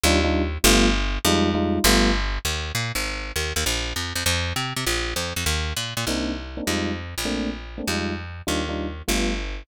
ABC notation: X:1
M:4/4
L:1/8
Q:"Swing" 1/4=199
K:Cm
V:1 name="Electric Piano 1"
[G,DEF] [G,DEF]3 [G,=A,=B,F]4 | [G,A,EF]2 [G,A,EF]2 [G,=A,=B,F]4 | [K:Eb] z8 | z8 |
z8 | [K:Cm] [B,CDE]3 [B,CDE] [G,A,EF]4 | [=A,B,CD]3 [A,B,CD] [G,_A,EF]4 | [G,DEF] [G,DEF]3 [G,=A,=B,F]4 |]
V:2 name="Electric Bass (finger)" clef=bass
E,,4 G,,,4 | F,,4 G,,,4 | [K:Eb] E,,2 B,, A,,,3 E,, E,, | B,,,2 F,, F,, F,,2 C, C, |
B,,,2 F,, F,, E,,2 B,, B,, | [K:Cm] C,,4 F,,3 B,,,- | B,,,4 F,,4 | E,,4 G,,,4 |]